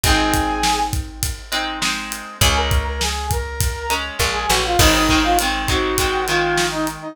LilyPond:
<<
  \new Staff \with { instrumentName = "Brass Section" } { \time 4/4 \key aes \mixolydian \tempo 4 = 101 <aes' aes''>4. r2 r8 | <aes' aes''>16 <bes' bes''>8 <bes' bes''>16 <aes' aes''>8 <bes' bes''>4 r8. <aes' aes''>16 <ges' ges''>16 <f' f''>16 | <ees' ees''>16 <ees' ees''>8 <f' f''>16 r8 <ges' ges''>4 <f' f''>8. <ees' ees''>16 r16 <ees' ees''>16 | }
  \new Staff \with { instrumentName = "Overdriven Guitar" } { \time 4/4 \key aes \mixolydian <aes c' ees'>2~ <aes c' ees'>8 <aes c' ees'>8 <aes c' ees'>4 | <aes des'>2~ <aes des'>8 <aes des'>8 <aes des'>4 | <ees aes c'>8 <ees aes c'>8 <ees aes c'>8 <ees aes c'>8 <ees aes c'>8 <ees aes c'>4. | }
  \new Staff \with { instrumentName = "Electric Bass (finger)" } { \clef bass \time 4/4 \key aes \mixolydian aes,,1 | des,2. bes,,8 a,,8 | aes,,1 | }
  \new DrumStaff \with { instrumentName = "Drums" } \drummode { \time 4/4 <bd cymr>8 <bd cymr>8 sn8 <bd cymr>8 <bd cymr>8 cymr8 sn8 cymr8 | <bd cymr>8 <bd cymr>8 sn8 <bd cymr>8 <bd cymr>8 cymr8 <bd sn>8 sn8 | <cymc bd>8 bd8 cymr8 <bd cymr>8 <bd cymr>8 cymr8 sn8 cymr8 | }
>>